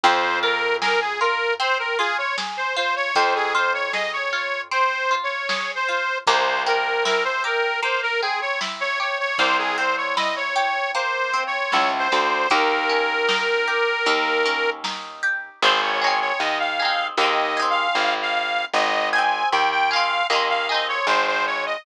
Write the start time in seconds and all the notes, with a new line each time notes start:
0.03 F2 C4 C5, kick, closed hi-hat
0.43 F4 A#4
0.82 G#4 A#4, snare
1.01 G#4
1.21 F4 A#4
1.60 C4 C5, closed hi-hat
1.79 A#4
1.99 F4 G#4
2.18 C#5
2.38 G#4, snare
2.57 C5
2.76 F4 C5
2.96 C#5
3.15 F2 C4 C5, kick, closed hi-hat
3.35 G#4
3.54 F4 C5
3.74 C#5
3.93 G#4 D#5, snare
4.13 C#5
4.33 F4
4.71 C4 C5, closed hi-hat
5.11 F4
5.23 C#5
5.49 G#4, snare
5.75 C5
5.88 F4
6.27 C2 A#3 C5, kick, closed hi-hat
6.66 C4 A#4
7.05 E4 A#4, snare
7.25 C5
7.44 G4 A#4
7.82 A#3 C5, closed hi-hat
8.02 A#4
8.22 C4 G#4
8.41 C#5
8.61 E4, snare
8.80 C#5
9.00 G4 C#5
9.19 C#5
9.38 C2 A#3 C5, kick, closed hi-hat
9.58 G#4
9.78 C4 C5
9.97 C#5
10.17 E4 D#5, snare
10.36 C#5
10.56 G4
10.94 A#3 C5, closed hi-hat
11.33 C4
11.47 C#5
11.72 C#2 E4, snare
11.99 C5
12.12 D2 G4
12.50 D#2 A#3 A#4, kick, closed hi-hat
12.89 C#4
13.28 D#4, snare
13.68 G4
14.06 D#2 A#3, closed hi-hat
14.45 C#4
14.84 D#4, snare
15.23 G4
15.62 G#1 D#4 G#4 C5
15.68 C4
15.82 C#5
16.01 D#4 G#4 C#5
16.07 C4
16.21 C#5
16.40 D#2 D#5
16.60 F5
16.79 D#4 G#4
16.85 C4
17.17 D#2 D#4 G#4 D#5
17.23 C4
17.57 D#4 G#4
17.62 C4
17.70 F5
17.95 G#1
18.22 F5
18.73 G#1 D#5
19.13 D#4 G#4 G#5
19.18 C4
19.52 D#2 G5
19.71 G5
19.91 D#4 G#4 F5
19.96 C4
20.30 D#2 D#4 G#4 D#5
20.35 C4
20.49 F5
20.69 D#4 G#4 D#5
20.74 C4
20.88 C#5
21.07 G#1 C5
21.27 C5
21.47 C#5
21.66 D#5